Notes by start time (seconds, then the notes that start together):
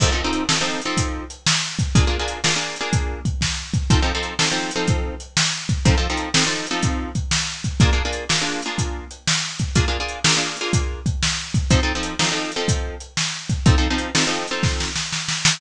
0.00 F3 C4 D#4 A4, kick, crash
0.12 F3 C4 D#4 A4
0.24 F3 C4 D#4 A4
0.33 closed hi-hat
0.49 F3 C4 D#4 A4, snare
0.61 F3 C4 D#4 A4
0.82 F3 C4 D#4 A4, closed hi-hat
0.97 kick, closed hi-hat
1.30 closed hi-hat
1.46 snare
1.79 kick, closed hi-hat
1.95 A#3 D4 F4 G#4, kick, closed hi-hat
2.07 A#3 D4 F4 G#4
2.19 A#3 D4 F4 G#4
2.28 closed hi-hat
2.44 A#3 D4 F4 G#4, snare
2.56 A#3 D4 F4 G#4
2.76 closed hi-hat
2.81 A#3 D4 F4 G#4
2.93 kick, closed hi-hat
3.25 kick, closed hi-hat
3.41 kick, snare
3.74 kick, closed hi-hat
3.90 F3 C4 D#4 A4, kick, closed hi-hat
4.02 F3 C4 D#4 A4
4.15 F3 C4 D#4 A4
4.23 closed hi-hat
4.39 F3 C4 D#4 A4, snare
4.51 F3 C4 D#4 A4
4.71 closed hi-hat
4.76 F3 C4 D#4 A4
4.88 kick, closed hi-hat
5.20 closed hi-hat
5.37 snare
5.69 kick, closed hi-hat
5.85 F3 C4 D#4 A4, kick, closed hi-hat
5.98 F3 C4 D#4 A4
6.10 F3 C4 D#4 A4
6.17 closed hi-hat
6.34 F3 C4 D#4 A4, snare
6.46 F3 C4 D#4 A4
6.67 closed hi-hat
6.71 F3 C4 D#4 A4
6.83 kick, closed hi-hat
7.15 kick, closed hi-hat
7.31 snare
7.64 kick, closed hi-hat
7.80 A#3 D4 F4 G#4, kick, closed hi-hat
7.93 A#3 D4 F4 G#4
8.05 A#3 D4 F4 G#4
8.13 closed hi-hat
8.29 A#3 D4 F4 G#4, snare
8.41 A#3 D4 F4 G#4
8.62 A#3 D4 F4 G#4, closed hi-hat
8.78 kick, closed hi-hat
9.11 closed hi-hat
9.27 snare
9.59 kick, closed hi-hat
9.75 A#3 D4 F4 G#4, kick, closed hi-hat
9.88 A#3 D4 F4 G#4
10.00 A#3 D4 F4 G#4
10.08 closed hi-hat
10.24 A#3 D4 F4 G#4, snare
10.37 A#3 D4 F4 G#4
10.57 closed hi-hat
10.61 A#3 D4 F4 G#4
10.73 kick, closed hi-hat
11.06 kick, closed hi-hat
11.23 snare
11.54 kick, closed hi-hat
11.70 F3 C4 D#4 A4, kick, closed hi-hat
11.83 F3 C4 D#4 A4
11.95 F3 C4 D#4 A4
12.03 closed hi-hat
12.19 F3 C4 D#4 A4, snare
12.32 F3 C4 D#4 A4
12.52 closed hi-hat
12.56 F3 C4 D#4 A4
12.68 kick, closed hi-hat
13.00 closed hi-hat
13.17 snare
13.49 kick, closed hi-hat
13.66 F3 C4 D#4 A4, kick, closed hi-hat
13.78 F3 C4 D#4 A4
13.90 F3 C4 D#4 A4
13.98 closed hi-hat
14.15 F3 C4 D#4 A4, snare
14.27 F3 C4 D#4 A4
14.48 F3 C4 D#4 A4, closed hi-hat
14.63 kick, snare
14.80 snare
14.96 snare
15.13 snare
15.28 snare
15.45 snare